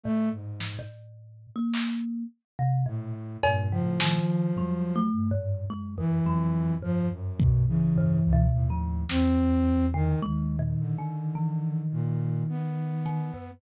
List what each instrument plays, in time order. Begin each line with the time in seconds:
0.04 kalimba A2, flute A3
0.32 flute G#2
0.60 snare
0.79 kalimba A2
1.56 kalimba A#3
1.74 clap
2.59 kalimba C3
2.86 flute A2, kalimba A#2
3.43 kalimba F2, flute G2 A#2, cowbell
3.71 kalimba C#3, flute F3
3.80 flute A2
4.00 kalimba D#3, snare
4.19 flute F3
4.57 flute F#3, kalimba G3, floor tom
4.96 kalimba A3
5.13 flute G2
5.31 kalimba G#2
5.70 flute F#2, kalimba G#3
5.98 kalimba F2, flute E3
6.26 flute F2, kalimba F#3
6.83 flute F2 F3, kalimba G2
7.11 flute F#2
7.40 flute B2, kick
7.68 flute C#3 E3
7.96 kalimba G2, floor tom
8.24 flute C#2
8.33 kalimba B2
8.52 flute D#2 A2
8.70 kalimba F3
9.09 flute E2 C4, snare
9.94 kalimba D3, flute D#3
10.22 flute D#2 D#3, kalimba G#3
10.59 kalimba A#2
10.79 flute D3
10.98 kalimba D#3
11.35 kalimba E3
11.92 flute A#2
12.49 flute B3
13.06 kalimba D#3, closed hi-hat
13.34 kalimba F#2